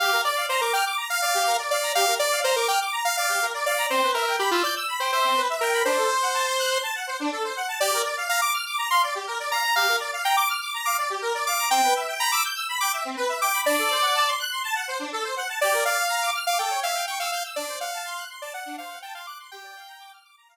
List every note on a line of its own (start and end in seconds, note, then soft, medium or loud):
0.00 0.11 G4 medium
0.00 0.21 F5 medium
0.12 0.23 A#4 medium
0.24 0.35 D5 medium
0.24 0.46 D5 medium
0.36 0.47 F5 medium
0.49 0.61 C5 medium
0.49 0.60 A#5 medium
0.61 0.73 A#4 medium
0.61 0.72 D6 medium
0.73 0.85 G5 medium
0.73 0.84 F6 medium
0.85 0.96 D6 medium
0.97 1.08 A#5 medium
1.10 1.21 F5 medium
1.22 1.33 D5 medium
1.22 1.57 F5 medium
1.34 1.45 G4 medium
1.47 1.58 A#4 medium
1.59 1.70 D5 medium
1.70 1.92 D5 medium
1.70 1.81 F5 medium
1.83 1.93 A#5 medium
1.95 2.06 G4 medium
1.95 2.15 F5 medium
2.07 2.18 A#4 medium
2.19 2.40 D5 medium
2.19 2.31 D5 medium
2.32 2.43 F5 medium
2.44 2.56 C5 medium
2.44 2.54 A#5 medium
2.56 2.68 A#4 medium
2.56 2.67 D6 medium
2.68 2.80 G5 medium
2.68 2.79 F6 medium
2.81 2.92 D6 medium
2.92 3.03 A#5 medium
3.05 3.16 F5 medium
3.17 3.28 D5 medium
3.17 3.46 F5 medium
3.29 3.40 G4 medium
3.42 3.53 A#4 medium
3.54 3.65 D5 medium
3.66 3.86 D5 medium
3.66 3.77 F5 medium
3.77 3.88 A#5 medium
3.90 4.01 C4 medium
3.90 4.11 C5 medium
4.03 4.14 B4 medium
4.14 4.36 A#4 medium
4.14 4.26 E5 medium
4.26 4.37 G5 medium
4.39 4.51 G4 medium
4.39 4.50 B5 medium
4.51 4.63 F4 medium
4.51 4.62 E6 medium
4.63 4.75 D5 medium
4.63 4.74 G6 medium
4.76 4.87 E6 medium
4.88 4.99 B5 medium
5.00 5.11 C5 medium
5.00 5.11 G5 medium
5.12 5.42 C5 medium
5.12 5.23 E5 medium
5.24 5.35 C4 medium
5.36 5.47 B4 medium
5.49 5.60 E5 medium
5.61 5.83 A#4 medium
5.61 5.72 G5 medium
5.73 5.84 B5 medium
5.85 5.96 D4 medium
5.85 6.78 C5 medium
5.97 6.08 A4 medium
6.10 6.21 C5 medium
6.22 6.33 F#5 medium
6.34 6.45 A5 medium
6.47 6.58 C6 medium
6.59 6.70 F#6 medium
6.71 6.82 C6 medium
6.83 6.94 A5 medium
6.95 7.06 F#5 medium
7.07 7.18 C5 medium
7.20 7.31 D4 medium
7.32 7.43 A4 medium
7.44 7.55 C5 medium
7.56 7.67 F#5 medium
7.68 7.79 A5 medium
7.80 7.91 G4 medium
7.80 8.02 D5 medium
7.93 8.04 A#4 medium
8.05 8.16 D5 medium
8.17 8.28 F5 medium
8.29 8.41 F5 medium
8.29 8.40 A#5 medium
8.41 8.53 D6 medium
8.53 8.64 F6 medium
8.66 8.77 D6 medium
8.78 8.89 A#5 medium
8.90 9.01 F5 medium
8.90 9.02 C6 medium
9.03 9.14 D5 medium
9.15 9.26 G4 medium
9.27 9.38 A#4 medium
9.39 9.50 D5 medium
9.51 9.62 F5 medium
9.51 9.75 A#5 medium
9.63 9.74 A#5 medium
9.76 9.86 G4 medium
9.76 9.96 F5 medium
9.88 9.99 A#4 medium
10.00 10.11 D5 medium
10.13 10.24 F5 medium
10.24 10.36 G5 medium
10.24 10.35 A#5 medium
10.37 10.48 D6 medium
10.49 10.60 F6 medium
10.61 10.72 D6 medium
10.74 10.85 A#5 medium
10.85 10.97 F5 medium
10.85 10.97 D6 medium
10.98 11.09 D5 medium
11.10 11.21 G4 medium
11.22 11.33 A#4 medium
11.34 11.45 D5 medium
11.46 11.57 F5 medium
11.46 11.69 D6 medium
11.58 11.69 A#5 medium
11.70 11.81 C4 medium
11.70 11.94 G5 medium
11.83 11.94 B4 medium
11.96 12.07 E5 medium
12.08 12.19 G5 medium
12.19 12.31 A#5 medium
12.19 12.30 B5 medium
12.32 12.43 D6 medium
12.32 12.43 E6 medium
12.44 12.55 G6 medium
12.55 12.66 E6 medium
12.69 12.80 B5 medium
12.80 12.92 G5 medium
12.80 12.92 D6 medium
12.93 13.04 E5 medium
13.05 13.16 C4 medium
13.17 13.28 B4 medium
13.29 13.40 E5 medium
13.41 13.52 G5 medium
13.41 13.61 D6 medium
13.53 13.64 B5 medium
13.65 13.76 D4 medium
13.65 14.30 D5 medium
13.78 13.89 A4 medium
13.90 14.01 C5 medium
14.02 14.13 F#5 medium
14.15 14.26 A5 medium
14.27 14.38 C6 medium
14.39 14.50 F#6 medium
14.51 14.62 C6 medium
14.64 14.74 A5 medium
14.75 14.86 F#5 medium
14.88 14.99 C5 medium
14.99 15.10 D4 medium
15.12 15.23 A4 medium
15.24 15.35 C5 medium
15.36 15.47 F#5 medium
15.49 15.60 A5 medium
15.61 15.72 G4 medium
15.61 15.84 D5 medium
15.73 15.84 A#4 medium
15.85 15.97 D5 medium
15.85 16.30 F5 medium
15.97 16.08 F5 medium
16.09 16.20 A#5 medium
16.22 16.33 D6 medium
16.34 16.45 F6 medium
16.46 16.58 F5 medium
16.46 16.57 D6 medium
16.59 16.70 A4 medium
16.59 16.80 G5 medium
16.70 16.81 C#5 medium
16.83 16.94 E5 medium
16.83 17.06 F5 medium
16.95 17.06 G5 medium
17.07 17.19 G5 medium
17.07 17.18 C#6 medium
17.19 17.31 F5 medium
17.19 17.30 E6 medium
17.32 17.43 F5 medium
17.32 17.43 G6 medium
17.44 17.55 E6 medium
17.56 17.67 D4 medium
17.56 17.79 D5 medium
17.68 17.79 C5 medium
17.80 18.24 F5 medium
17.80 17.91 F#5 medium
17.93 18.04 A5 medium
18.05 18.16 C6 medium
18.18 18.29 F#6 medium
18.29 18.40 C6 medium
18.42 18.53 D5 medium
18.42 18.53 A5 medium
18.54 18.65 F#5 medium
18.54 18.76 F#5 medium
18.66 18.77 D4 medium
18.78 18.89 C5 medium
18.78 18.99 F5 medium
18.90 19.01 F#5 medium
19.02 19.14 G5 medium
19.02 19.14 A5 medium
19.14 19.26 F5 medium
19.14 19.25 C6 medium
19.27 19.38 D6 medium
19.27 19.38 F#6 medium
19.39 19.50 C6 medium
19.51 19.63 G4 medium
19.51 20.12 G5 medium
19.63 19.74 D5 medium
19.76 19.87 F5 medium
19.88 19.99 A#5 medium
20.00 20.11 D6 medium
20.12 20.23 F6 medium
20.24 20.35 D6 medium
20.37 20.48 A#5 medium
20.48 20.57 F5 medium